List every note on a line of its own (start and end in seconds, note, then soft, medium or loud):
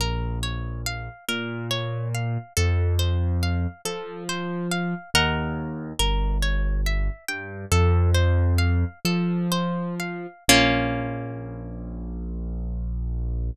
0.00 1.09 A#1 loud
0.00 0.39 A#4 medium
0.43 0.82 C#5 medium
0.86 1.25 F5 medium
1.28 2.38 A#2 loud
1.28 1.67 A#4 medium
1.71 2.09 C#5 medium
2.14 2.53 F5 medium
2.57 3.67 F2 loud
2.57 2.95 A4 medium
2.99 3.38 C5 medium
3.43 3.81 F5 medium
3.85 4.94 F3 medium
3.85 4.24 A4 medium
4.29 4.68 C5 medium
4.71 5.10 F5 medium
5.14 5.93 D#2 loud
5.14 5.92 A#4 medium
5.14 5.92 D#5 medium
5.14 5.92 F#5 medium
5.99 7.09 G1 loud
5.99 6.38 A#4 medium
6.43 6.81 C#5 medium
6.86 7.25 E5 medium
7.28 7.65 G2 loud
7.28 7.67 G5 medium
7.72 8.84 F2 loud
7.72 8.11 A4 medium
8.14 8.54 C5 medium
8.58 8.99 F5 medium
9.05 10.27 F3 medium
9.05 9.47 A4 medium
9.52 9.95 C5 medium
10.00 10.44 F5 medium
10.48 13.50 A#1 loud
10.48 13.51 A#3 loud
10.48 13.51 C#4 loud
10.48 13.51 F4 loud